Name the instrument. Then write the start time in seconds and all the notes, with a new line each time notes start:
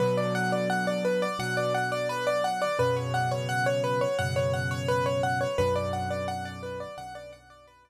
acoustic grand piano
0.00 B2 D3 F#3 B4
0.17 D5
0.35 F#5
0.52 D5
0.70 F#5
0.87 D5
1.05 B4
1.22 D5
1.39 B2 D3 F#3 F#5
1.57 D5
1.74 F#5
1.92 D5
2.09 B4
2.27 D5
2.44 F#5
2.62 D5
2.79 F#2 B2 C#3 B4
2.97 C#5
3.14 F#5
3.31 C#5
3.49 F#5
3.66 C#5
3.84 B4
4.01 C#5
4.19 F#2 B2 C#3 F#5
4.36 C#5
4.53 F#5
4.71 C#5
4.88 B4
5.06 C#5
5.23 F#5
5.41 C#5
5.58 B1 F#2 D3 B4
5.76 D5
5.93 F#5
6.10 D5
6.28 F#5
6.45 D5
6.63 B4
6.80 D5
6.97 B1 F#2 D3 F#5
7.15 D5
7.33 F#5
7.50 D5
7.67 B4
7.85 D5